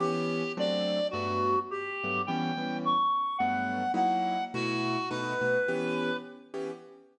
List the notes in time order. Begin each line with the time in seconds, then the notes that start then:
0.00 E3 B3 C#4 G4
0.57 F#3 A3 C4 D4 D5
1.11 G2 F#3 A3 B3 F#4
1.71 G4
2.04 G2 F#3 A3 B3
2.27 E3 G3 B3 C#4 G5
2.57 E3 G3 B3 C#4
2.85 C#6
3.38 G2 F#3 A3 B3 F#5
3.94 F#3 A#3 D#4 E4 F#5
4.54 B2 A3 E4 F#4
5.10 B2 A3 D#4 F#4 B4
5.41 B2 A3 D#4 F#4
5.68 E3 B3 C#4 G4
6.54 E3 B3 C#4 G4